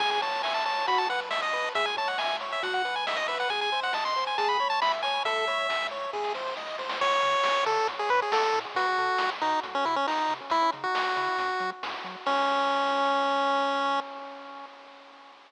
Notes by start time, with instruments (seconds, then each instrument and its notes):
0.00 synth bass 1 C#2, lead 1 (square) G#4 G#5, kick, crash
0.11 lead 1 (square) G#5, closed hi-hat
0.22 lead 1 (square) C#5 A5, closed hi-hat
0.32 closed hi-hat
0.43 lead 1 (square) E5 G#5, snare
0.54 lead 1 (square) A5, closed hi-hat
0.65 lead 1 (square) C#5 A5, closed hi-hat
0.78 closed hi-hat
0.87 synth bass 1 B1, lead 1 (square) F#4 B5, kick, closed hi-hat
0.98 lead 1 (square) A5, closed hi-hat
1.09 lead 1 (square) B4 F#5, closed hi-hat
1.20 closed hi-hat
1.31 lead 1 (square) D#5 E5, snare
1.42 lead 1 (square) D#5, closed hi-hat
1.53 lead 1 (square) B4, closed hi-hat
1.64 closed hi-hat
1.75 synth bass 1 C#2, lead 1 (square) G#4 E5, kick, closed hi-hat
1.86 lead 1 (square) G#5, closed hi-hat
1.97 lead 1 (square) C#5 A5, kick, closed hi-hat
2.08 lead 1 (square) F#5, closed hi-hat
2.18 lead 1 (square) E5 G#5, snare
2.29 closed hi-hat
2.40 lead 1 (square) C#5, closed hi-hat
2.52 lead 1 (square) E5, closed hi-hat
2.63 synth bass 1 B1, lead 1 (square) F#4 F#5, kick, closed hi-hat
2.74 lead 1 (square) F#5, closed hi-hat
2.85 lead 1 (square) B4, closed hi-hat
2.96 lead 1 (square) G#5, closed hi-hat
3.06 lead 1 (square) D#5 E5, snare
3.17 lead 1 (square) D#5, closed hi-hat
3.28 lead 1 (square) B4 E5, closed hi-hat
3.40 lead 1 (square) F#5, closed hi-hat
3.49 synth bass 1 G#1, lead 1 (square) G#4 G#5, kick, closed hi-hat
3.61 lead 1 (square) G#5, closed hi-hat
3.72 lead 1 (square) C5, closed hi-hat
3.83 lead 1 (square) F#5, closed hi-hat
3.93 lead 1 (square) D#5 A5, snare
4.05 lead 1 (square) C6, closed hi-hat
4.16 lead 1 (square) C5, closed hi-hat
4.26 lead 1 (square) G#5, closed hi-hat
4.38 synth bass 1 C#2, lead 1 (square) G#4 A5, kick, closed hi-hat
4.48 lead 1 (square) B5, closed hi-hat
4.59 lead 1 (square) C#5, closed hi-hat
4.70 lead 1 (square) A5, closed hi-hat
4.82 lead 1 (square) E5 B5, snare
4.92 closed hi-hat
5.03 lead 1 (square) C#5 G#5, closed hi-hat
5.14 closed hi-hat
5.25 synth bass 1 C#2, lead 1 (square) A4 E5, kick, closed hi-hat
5.36 closed hi-hat
5.47 lead 1 (square) C#5, kick, closed hi-hat
5.58 closed hi-hat
5.69 lead 1 (square) E5, snare
5.81 closed hi-hat
5.91 lead 1 (square) C#5, closed hi-hat
6.01 closed hi-hat
6.13 synth bass 1 G#1, lead 1 (square) G#4, kick, snare
6.24 snare
6.34 lead 1 (square) C5, snare
6.46 snare
6.56 synth bass 1 B1, lead 1 (square) D#5, snare
6.67 snare
6.78 synth bass 1 C2, lead 1 (square) C5, snare
6.89 snare
7.01 synth bass 1 C#2, lead 1 (square) C#5, kick, crash
7.23 synth bass 1 C#3, closed hi-hat
7.43 synth bass 1 C#2, snare
7.66 synth bass 1 C#3, lead 1 (square) A4, closed hi-hat
7.88 synth bass 1 A1, kick, closed hi-hat
7.99 lead 1 (square) G#4
8.09 synth bass 1 A2, lead 1 (square) B4, closed hi-hat
8.22 lead 1 (square) G#4
8.32 synth bass 1 A1, lead 1 (square) A4, snare
8.54 synth bass 1 A2, closed hi-hat
8.75 synth bass 1 B1, lead 1 (square) F#4, kick, closed hi-hat
8.97 synth bass 1 B2, closed hi-hat
9.18 synth bass 1 B1, snare
9.41 synth bass 1 B2, lead 1 (square) D#4, closed hi-hat
9.63 synth bass 1 C2, kick, closed hi-hat
9.75 lead 1 (square) C#4
9.85 synth bass 1 C3, lead 1 (square) E4, closed hi-hat
9.96 lead 1 (square) C#4
10.07 synth bass 1 C2, lead 1 (square) D#4, snare
10.29 synth bass 1 C3, closed hi-hat
10.50 synth bass 1 C#2, lead 1 (square) E4, kick, closed hi-hat
10.72 synth bass 1 C#3, closed hi-hat
10.84 lead 1 (square) F#4
10.94 synth bass 1 C#2, snare
11.16 synth bass 1 C#3, closed hi-hat
11.37 synth bass 1 F#2, kick, closed hi-hat
11.60 synth bass 1 F#3, closed hi-hat
11.83 synth bass 1 F#2, snare
12.04 synth bass 1 F#3, closed hi-hat
12.26 synth bass 1 C#2, lead 1 (square) C#4, kick, crash